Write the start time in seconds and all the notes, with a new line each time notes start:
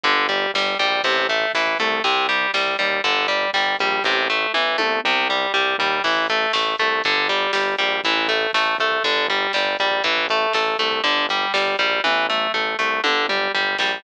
0.04 G1 D3, kick, closed hi-hat
0.17 kick
0.29 G3, kick, closed hi-hat
0.42 kick
0.54 G1 G3, kick, snare
0.66 kick
0.79 A#1 G3, kick, closed hi-hat
0.92 kick
1.03 A1 C3, kick, closed hi-hat
1.18 kick
1.29 A3, kick, closed hi-hat
1.41 kick
1.54 A1 E3, kick, snare
1.67 kick
1.79 C2 A3, kick, closed hi-hat
1.92 kick
2.04 C2 C3, kick, closed hi-hat
2.16 kick
2.29 G3, kick, closed hi-hat
2.42 kick
2.54 C2 G3, kick, snare
2.67 kick
2.79 D#2 G3, kick, closed hi-hat
2.92 kick
3.04 G1 D3, kick, closed hi-hat
3.16 kick
3.28 G3, kick, closed hi-hat
3.42 kick
3.53 G1 G3, kick, snare
3.66 kick
3.79 A#1 G3, kick, closed hi-hat
3.92 kick
4.04 A1 C3, kick, snare
4.30 A3
4.54 A1 E3, high tom
4.78 C2 A3, high tom
5.04 C2 C3, mid tom
5.30 G3
5.54 C2 G3, floor tom
5.78 D#2 G3, floor tom
6.04 A1 E3, kick, crash
6.16 kick
6.29 A3, kick, closed hi-hat
6.42 kick
6.53 A1 A3, kick, snare
6.66 kick
6.78 C2 A3, kick, closed hi-hat
6.92 kick
7.04 G1 D3, kick, closed hi-hat
7.16 kick
7.29 G3, kick, closed hi-hat
7.41 kick
7.53 G1 G3, kick, snare
7.67 kick
7.78 A#1 G3, kick, closed hi-hat
7.91 kick
8.04 A1 E3, kick, closed hi-hat
8.18 kick
8.28 A3, kick, closed hi-hat
8.41 kick
8.53 A1 A3, kick, snare
8.66 kick
8.78 C2 A3, kick, closed hi-hat
8.91 kick
9.04 G1 D3, kick, closed hi-hat
9.16 kick
9.28 G3, kick, closed hi-hat
9.42 kick
9.53 G1 G3, kick, snare
9.66 kick
9.79 A#1 G3, kick, closed hi-hat
9.91 kick
10.04 A1 E3, kick, closed hi-hat
10.18 kick
10.29 A3, kick, closed hi-hat
10.42 kick
10.53 A1 A3, kick, snare
10.68 kick
10.79 C2 A3, kick, closed hi-hat
10.92 kick
11.04 G1 D3, kick, closed hi-hat
11.18 kick
11.29 G3, kick, closed hi-hat
11.42 kick
11.53 G1 G3, kick, snare
11.67 kick
11.79 A#1 G3, kick, closed hi-hat
11.93 kick
12.04 A1 E3, kick, high tom
12.29 A3, mid tom
12.54 A1 A3, floor tom
12.79 C2 A3
13.04 G1 D3, high tom
13.28 G3, mid tom
13.54 G1 G3, floor tom
13.78 A#1 G3, snare